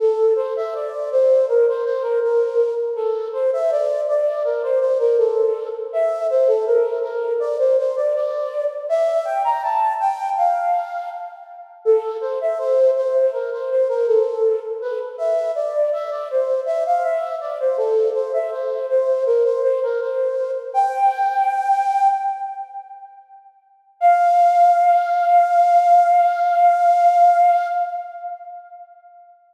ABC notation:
X:1
M:4/4
L:1/16
Q:1/4=81
K:F
V:1 name="Flute"
A2 c e d2 c2 B c c B B3 z | A2 c e d2 d2 B c c B A3 z | e2 c A B2 B2 d c c d d3 z | e2 g b a2 g2 f4 z4 |
A2 c e c2 c2 B c c B A3 z | =B z e2 d2 e d c2 e f e2 d c | A2 c e c2 c2 B c c B c3 z | "^rit." g8 z8 |
f16 |]